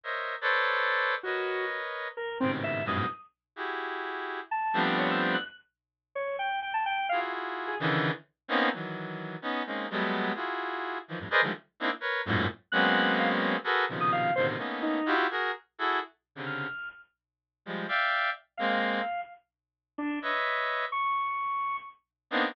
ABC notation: X:1
M:7/8
L:1/16
Q:1/4=128
K:none
V:1 name="Clarinet"
[_Bc_d_e=e]3 [A=Bcd=d]7 | [_B=B_d_e]8 z2 [_A,,=A,,B,,C,_D,_E,]4 | [_G,,=G,,_A,,=A,,B,,]2 z4 [E_G=G_A]8 | z2 [F,G,A,B,CD]6 z6 |
z8 [EF_G_A]6 | [_D,=D,_E,=E,]3 z3 [_B,=B,C_D_E]2 [_E,=E,_G,]6 | [B,_D_E]2 [_A,_B,CDE]2 [_G,=G,A,=A,=B,]4 [=EF_G_A]6 | [_E,=E,F,] [F,,G,,A,,] [_A_B=Bcd_e] [D,_E,F,G,_A,=A,] z2 [_B,CD_E=E] z [_B=B_d]2 [_G,,_A,,=A,,_B,,]2 z2 |
[_G,_A,_B,=B,C_D]8 [_G_A=A_B=B]2 [_B,,=B,,C,_D,_E,F,]4 | [A,,B,,C,D,_E,]2 [A,_B,=B,_D_E]4 [=EF_G=G]2 [_G_A_B]2 z2 [EGA=A]2 | z3 [C,_D,=D,]3 z8 | [F,G,_A,]2 [defg]4 z2 [A,_B,C]4 z2 |
z8 [B_d_e=e]6 | z12 [_B,=B,CD_E]2 |]
V:2 name="Lead 1 (square)"
z10 | _G4 z4 _B2 C z e2 | _e'2 z12 | a3 z _d e' z _g' z6 |
_d2 g2 g a g2 f z4 _A | z14 | z14 | z14 |
_g'4 f z6 _e' f2 | c z3 _E3 z7 | z4 f'4 z6 | z8 f6 |
z6 D2 z6 | _d'8 z6 |]